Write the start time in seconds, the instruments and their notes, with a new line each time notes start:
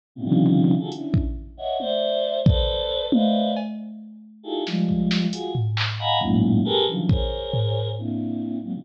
0.15 choir aahs A2 B2 C3 C#3
0.24 choir aahs C3 C#3 D3 D#3 F3 G3
0.79 choir aahs D#4 F4 F#4 G#4 A4
0.92 choir aahs C#4 D4 E4, closed hi-hat
1.14 kick
1.57 choir aahs C#5 D#5 E5 F#5
1.79 choir aahs C5 D5 E5, high tom
2.46 choir aahs A4 B4 C5 D5, kick
3.12 choir aahs B4 C5 D5 D#5 E5 F5, high tom
3.56 cowbell
4.43 choir aahs D#4 E4 F4 G4 G#4 A4
4.67 choir aahs F3 G3 G#3, snare
4.89 kick
5.11 snare
5.32 choir aahs F4 F#4 G#4, closed hi-hat
5.55 floor tom
5.77 clap
5.99 choir aahs D#5 F5 F#5 G#5 A#5 B5
6.21 choir aahs F#2 G#2 A2 A#2, kick
6.65 choir aahs G4 G#4 A4 A#4 B4
6.87 choir aahs C#3 D3 E3 F3 F#3
7.09 choir aahs G#4 A#4 C5 C#5, kick
7.53 floor tom
7.98 choir aahs A#3 C4 D4 E4
8.63 choir aahs F#3 G#3 A#3 C4
8.74 choir aahs B2 C#3 D3 D#3 F3 G3